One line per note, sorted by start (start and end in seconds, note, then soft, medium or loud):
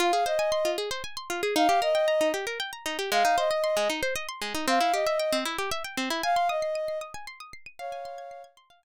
0.00 0.12 F4 medium
0.00 0.24 F5 loud
0.13 0.25 G#4 medium
0.26 0.38 C5 medium
0.26 0.70 D#5 loud
0.39 0.51 G#5 medium
0.52 0.64 C6 medium
0.65 0.77 F4 medium
0.78 0.90 G#4 medium
0.91 1.03 C5 medium
1.04 1.16 G#5 medium
1.17 1.29 C6 medium
1.30 1.42 F4 medium
1.43 1.55 G#4 medium
1.56 1.68 D#4 medium
1.56 1.79 F5 loud
1.69 1.81 G4 medium
1.82 1.94 A#4 medium
1.82 2.28 D#5 loud
1.95 2.06 G5 medium
2.08 2.19 A#5 medium
2.21 2.32 D#4 medium
2.34 2.45 G4 medium
2.47 2.58 A#4 medium
2.60 2.71 G5 medium
2.73 2.84 A#5 medium
2.86 2.97 D#4 medium
2.99 3.10 G4 medium
3.11 3.23 G#3 medium
3.11 3.36 F5 loud
3.25 3.36 D#4 medium
3.38 3.49 C5 medium
3.38 3.88 D#5 loud
3.51 3.62 D#5 medium
3.64 3.75 C6 medium
3.77 3.88 G#3 medium
3.90 4.01 D#4 medium
4.03 4.14 C5 medium
4.16 4.27 D#5 medium
4.29 4.40 C6 medium
4.42 4.53 G#3 medium
4.55 4.66 D#4 medium
4.68 4.79 C4 medium
4.68 4.93 F5 loud
4.81 4.92 E4 medium
4.93 5.05 G4 medium
4.93 5.37 D#5 medium
5.06 5.18 E5 medium
5.19 5.31 G5 medium
5.32 5.44 C4 medium
5.45 5.57 E4 medium
5.58 5.70 G4 medium
5.71 5.83 E5 medium
5.84 5.96 G5 medium
5.97 6.09 C4 medium
6.10 6.22 E4 medium
6.23 6.48 F5 loud
6.23 6.35 G#5 medium
6.36 6.48 C6 medium
6.49 6.98 D#5 loud
6.49 6.61 D#6 medium
6.62 6.74 C7 medium
6.75 6.87 D#7 medium
6.88 7.00 C7 medium
7.01 7.13 D#6 medium
7.14 7.26 G#5 medium
7.27 7.39 C6 medium
7.40 7.52 D#6 medium
7.53 7.65 C7 medium
7.66 7.78 D#7 medium
7.79 8.42 C#5 loud
7.79 8.42 F5 loud
7.79 7.91 F5 medium
7.92 8.04 G#5 medium
8.05 8.17 C6 medium
8.18 8.30 G#6 medium
8.31 8.43 C7 medium
8.44 8.56 G#6 medium
8.57 8.69 C6 medium
8.70 8.82 F5 medium
8.83 8.84 G#5 medium